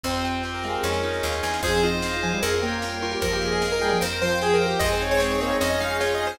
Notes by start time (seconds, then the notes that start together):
0.04 F2 C4 F4 G4 C5, kick, snare
0.24 F4 G5, snare
0.43 G4 C5, snare
0.54 A#4
0.63 G#3 C4 F5, snare
0.83 F2 C#4 D#4 F4 G#4 C#5, snare
0.93 snare
1.03 D#4 D#5, snare
1.13 snare
1.23 D#2 F4 F5, snare
1.32 snare
1.43 E2 G#4 G#5, snare
1.53 snare
1.63 F2 F3 C4 D#4 F4 G#4 C5, kick, crash
1.83 F4 D#5
2.02 C4 D#4 G#4 C5 F5, snare
2.23 F3 G#5, snare
2.33 G3
2.42 F2 A#3 C#4 G4 G#4 A#4, closed hi-hat
2.54 F4
2.62 A#3 C#5 G5
2.82 G3 A#3 G4 A#4 G5, snare
3.02 F4 A#4 C#5
3.12 G4
3.22 F2 F3 A#3 D#4 F4 G4 A#4, kick, closed hi-hat
3.33 G4
3.41 G#4 D#5
3.52 G#4
3.62 A#3 D#4 G4 G#4 A#4 F5, snare
3.72 A#4
3.81 G3 G#4 G5, snare
3.92 F3
4.01 F2 C4 F4 G4 A#4 C5, closed hi-hat
4.13 A#4
4.21 F3 C5 F5 G5
4.41 C4 G4 G#4 C5 G5, snare
4.54 A#4
4.61 C5 F5
4.66 G4
4.79 F2 G#3 C4 D#4 G#4 C5 D#5, kick, closed hi-hat
4.92 C5
5.01 D#4 C#5 G#5
5.11 C#5
5.20 G#4 C5 C#5, snare
5.31 C#5
5.40 A#3 C4 C#5 D#5, snare
5.51 G#3
5.60 F2 C#4 D#4 F4 G#4 C#5 D#5, closed hi-hat
5.70 D#5
5.80 G#3 D#4 D#5 F5
6.00 F4 C#5 F5, snare
6.15 D#5
6.20 G#4 G#5
6.27 C5